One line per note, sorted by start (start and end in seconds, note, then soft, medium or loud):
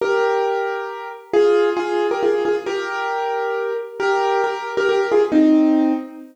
0.01 1.08 G4 medium
0.01 1.08 A#4 medium
1.33 1.70 F4 medium
1.33 1.70 G#4 loud
1.77 2.07 F4 medium
1.77 2.07 G#4 loud
2.11 2.22 G4 medium
2.11 2.22 A#4 medium
2.23 2.43 F4 medium
2.23 2.43 G#4 medium
2.45 2.56 F4 medium
2.45 2.56 G#4 medium
2.66 3.73 G4 medium
2.66 3.73 A#4 loud
4.00 4.42 G4 medium
4.00 4.42 A#4 loud
4.44 4.71 G4 medium
4.44 4.71 A#4 medium
4.77 4.88 G4 medium
4.77 4.88 A#4 loud
4.89 5.07 G4 medium
4.89 5.07 A#4 medium
5.12 5.22 F4 medium
5.12 5.22 G#4 medium
5.32 5.93 C4 medium
5.32 5.93 D#4 loud